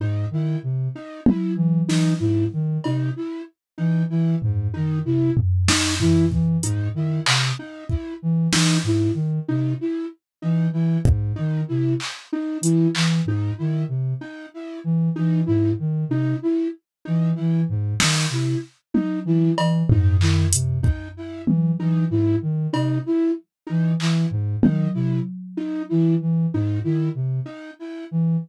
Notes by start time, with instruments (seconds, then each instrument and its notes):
0.00 ocarina G#2, flute D#4
0.31 ocarina D#3, flute E4
0.63 ocarina C3
0.96 flute D#4
1.26 flute E4, high tom
1.56 ocarina E3
1.88 ocarina E3, flute D#4, snare
2.20 ocarina G#2, flute E4
2.53 ocarina D#3
2.84 ocarina C3, flute D#4, cowbell
3.16 flute E4
3.78 ocarina E3, flute D#4
4.10 ocarina E3, flute E4
4.42 ocarina G#2, floor tom
4.74 ocarina D#3, flute D#4
5.05 ocarina C3, flute E4
5.37 floor tom
5.68 flute D#4, snare
6.00 ocarina E3, flute E4, floor tom
6.32 ocarina E3, kick
6.63 ocarina G#2, flute D#4, closed hi-hat
6.94 ocarina D#3, flute E4
7.26 ocarina C3, clap
7.59 flute D#4
7.89 flute E4, kick
8.22 ocarina E3
8.53 ocarina E3, flute D#4, snare
8.84 ocarina G#2, flute E4
9.14 ocarina D#3
9.48 ocarina C3, flute D#4
9.81 flute E4
10.42 ocarina E3, flute D#4
10.72 ocarina E3, flute E4
11.05 ocarina G#2, kick
11.36 ocarina D#3, flute D#4
11.68 ocarina C3, flute E4
12.00 clap
12.33 flute D#4
12.61 ocarina E3, flute E4, closed hi-hat
12.95 ocarina E3, clap
13.26 ocarina G#2, flute D#4
13.58 ocarina D#3, flute E4
13.88 ocarina C3
14.21 flute D#4
14.54 flute E4
14.84 ocarina E3
15.16 ocarina E3, flute D#4
15.46 ocarina G#2, flute E4
15.79 ocarina D#3
16.09 ocarina C3, flute D#4
16.42 flute E4
17.05 ocarina E3, flute D#4
17.35 ocarina E3, flute E4
17.69 ocarina G#2
18.00 ocarina D#3, flute D#4, snare
18.30 ocarina C3, flute E4
18.94 flute D#4, high tom
19.25 ocarina E3, flute E4
19.58 ocarina E3, cowbell
19.89 ocarina G#2, flute D#4, floor tom
20.20 ocarina D#3, flute E4, clap
20.53 ocarina C3, closed hi-hat
20.83 flute D#4, kick
21.17 flute E4
21.46 ocarina E3, high tom
21.80 ocarina E3, flute D#4
22.10 ocarina G#2, flute E4
22.42 ocarina D#3
22.73 ocarina C3, flute D#4, cowbell
23.06 flute E4
23.67 ocarina E3, flute D#4
24.00 ocarina E3, flute E4, clap
24.31 ocarina G#2
24.62 ocarina D#3, flute D#4, high tom
24.94 ocarina C3, flute E4
25.57 flute D#4
25.89 ocarina E3, flute E4
26.21 ocarina E3
26.54 ocarina G#2, flute D#4
26.84 ocarina D#3, flute E4
27.15 ocarina C3
27.46 flute D#4
27.79 flute E4
28.11 ocarina E3